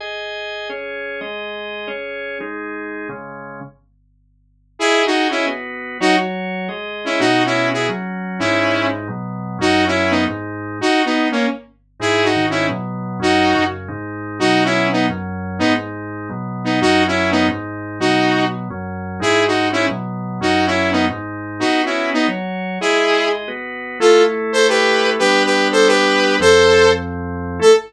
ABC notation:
X:1
M:7/8
L:1/16
Q:1/4=175
K:G#m
V:1 name="Lead 2 (sawtooth)"
z14 | z14 | z14 | z14 |
[EG]3 [DF]3 [CE]2 z6 | [DF]2 z10 [CE]2 | [DF]3 [CE]3 [EG]2 z6 | [CE]6 z8 |
[DF]3 [CE]3 [B,D]2 z6 | [DF]3 [B,D]3 [A,C]2 z6 | [EG]3 [DF]3 [CE]2 z6 | [DF]6 z8 |
[DF]3 [CE]3 [B,D]2 z6 | [B,D]2 z10 [B,D]2 | [DF]3 [CE]3 [B,D]2 z6 | [DF]6 z8 |
[EG]3 [DF]3 [CE]2 z6 | [DF]3 [CE]3 [B,D]2 z6 | [DF]3 [CE]3 [B,D]2 z6 | [EG]6 z8 |
[K:Am] [FA]3 z3 [Ac]2 [GB]6 | [GB]3 [GB]3 [Ac]2 [GB]6 | [Ac]6 z8 | A4 z10 |]
V:2 name="Drawbar Organ"
[Gdg]8 [CGc]6 | [G,Gd]8 [CGc]6 | [G,DG]8 [C,G,C]6 | z14 |
[Gdg]8 [B,FB]6 | [F,Fc]8 [G,Gd]6 | [B,,B,F]8 [F,CF]6 | [G,,G,D]8 [B,,F,B,]6 |
[F,,F,C]8 [G,,G,D]6 | z14 | [G,,G,D]4 [G,,D,D]4 [B,,F,B,]6 | [F,,F,C]4 [F,,C,C]4 [G,,G,D]6 |
[B,,F,B,]8 [F,,F,C]6 | [G,,G,D]8 [B,,F,B,]6 | [F,,F,C]8 [G,,G,D]6 | [B,,F,B,]8 [F,,F,C]6 |
[G,,G,D]8 [B,,F,B,]6 | [F,,F,C]8 [G,,G,D]6 | [B,FB]8 [F,Fc]6 | [G,Gd]8 [B,FB]6 |
[K:Am] [A,EA]14 | [G,B,D]14 | [F,,F,C]14 | [A,EA]4 z10 |]